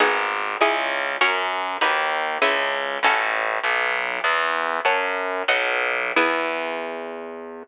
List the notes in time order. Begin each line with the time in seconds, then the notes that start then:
0.00 G#1 B3 D#4 G#4
0.61 C#2 C#4 E4 G#4
1.21 F#2 C#4 F#4 A#4
1.81 D#2 D#4 F#4 B4
2.42 C#2 C#4 E4 G#4
3.03 A1 C#4 F#4 A4
3.64 B1
4.24 E2
4.85 F#2 C#5 F#5 A5
5.48 B1 B4 D#5 F#5
6.16 E2 B3 E4 G#4